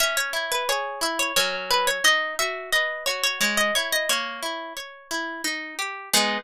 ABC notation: X:1
M:3/4
L:1/16
Q:1/4=88
K:G#m
V:1 name="Orchestral Harp"
e c2 B c2 e c c z B c | d2 e2 d2 c c c d c d | c6 z6 | G4 z8 |]
V:2 name="Orchestral Harp"
C2 E2 G2 E2 [F,CA]4 | D2 F2 B2 F2 G,2 E2 | A,2 E2 c2 E2 D2 =G2 | [G,B,D]4 z8 |]